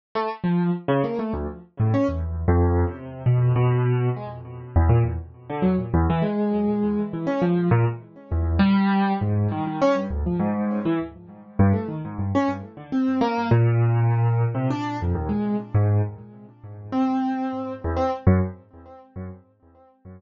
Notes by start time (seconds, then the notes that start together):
0.15 A3
0.44 F3
0.88 C#3
1.04 A#3
1.19 A3
1.33 D2
1.80 A2
1.94 C#4
2.08 E2
2.48 F2
2.87 C3
3.26 B2
3.56 B2
4.16 G#3
4.76 E2
4.89 A#2
5.04 E2
5.50 D3
5.62 F#3
5.94 E2
6.10 E3
6.22 G#3
7.13 E3
7.27 C#4
7.42 F3
7.71 A#2
8.32 E2
8.59 G3
9.21 G#2
9.51 D#3
9.67 D#3
9.82 C#4
9.95 G2
10.10 D2
10.26 F3
10.39 G#2
10.85 E3
11.59 G2
11.73 A3
11.88 D#3
12.05 G#2
12.18 G2
12.35 C#4
12.77 D3
12.92 C4
13.21 A#3
13.51 A#2
14.55 C3
14.70 D4
15.02 F2
15.15 D#2
15.29 G#3
15.75 G#2
16.92 C4
17.84 E2
17.97 C4
18.27 F#2